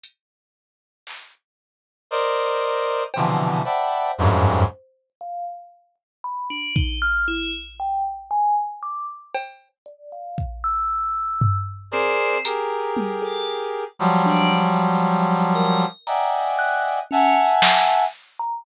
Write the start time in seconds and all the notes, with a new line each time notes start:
0.03 closed hi-hat
1.07 clap
2.11 A#4 C5 D5 D#5
3.14 B2 C3 D3 E3 F3, cowbell
3.65 C5 D5 E5 F#5 G5 A5 B5
4.18 F2 F#2 G2 G#2
5.21 F5
6.24 B5
6.50 D4
6.76 D#4, kick
7.02 F6
7.28 E4
7.80 G5
8.31 G#5
8.83 D6
9.34 cowbell
9.86 D5
10.12 F5
10.38 kick
10.64 E6
11.41 floor tom
11.91 C4 G#4 A#4 C5 D5
12.45 G4 G#4 A#4 A#5, closed hi-hat
12.97 high tom
13.22 A4
13.99 F3 F#3 G3
14.26 D4
15.55 A#4
16.07 D5 D#5 E5 F#5 G5 G#5 A#5, closed hi-hat
16.59 F#6
17.11 C#4 E5 F#5 G#5 A5
17.62 snare
18.39 A#5